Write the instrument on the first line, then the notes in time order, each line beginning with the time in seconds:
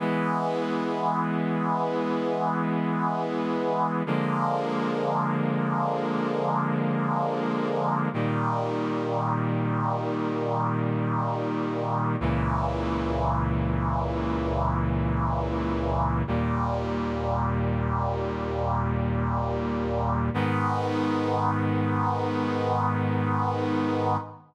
brass section
0.00 E3 G#3 B3
4.06 D3 F3 G#3 A#3
8.14 A#2 D#3 G3
12.21 C#2 A#2 E3
16.27 D#2 A#2 G3
20.34 G#2 D#3 B3